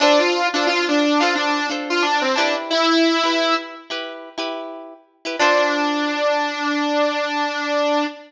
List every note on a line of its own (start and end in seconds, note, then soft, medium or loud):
0.00 0.42 D4 medium
0.00 0.19 D4 loud
0.00 0.42 F4 medium
0.00 0.42 A4 medium
0.00 0.42 C5 medium
0.19 0.47 F4 medium
0.54 0.67 D4 loud
0.54 1.06 D4 medium
0.54 1.06 F4 medium
0.54 1.06 A4 medium
0.54 1.06 C5 medium
0.67 0.86 F4 loud
0.88 1.20 D4 loud
1.20 1.60 D4 medium
1.20 1.33 F4 medium
1.20 1.60 F4 medium
1.20 1.60 A4 medium
1.20 1.60 C5 medium
1.35 1.67 D4 loud
1.70 2.26 D4 medium
1.70 2.26 F4 medium
1.70 2.26 A4 medium
1.70 2.26 C5 medium
1.90 2.03 F4 loud
2.02 2.21 D4 loud
2.21 2.35 C4 loud
2.35 2.54 D4 loud
2.35 3.13 E4 medium
2.35 3.13 G4 loud
2.35 3.13 B4 medium
2.70 3.54 E4 loud
3.23 3.75 E4 medium
3.23 3.75 G4 medium
3.23 3.75 B4 medium
3.90 4.29 E4 medium
3.90 4.29 G4 medium
3.90 4.29 B4 medium
4.38 4.94 E4 medium
4.38 4.94 G4 medium
4.38 4.94 B4 medium
5.25 5.36 E4 medium
5.25 5.36 G4 medium
5.25 5.36 B4 medium
5.39 8.05 D4 loud
5.39 8.05 F4 loud
5.39 8.05 A4 loud
5.39 8.05 C5 loud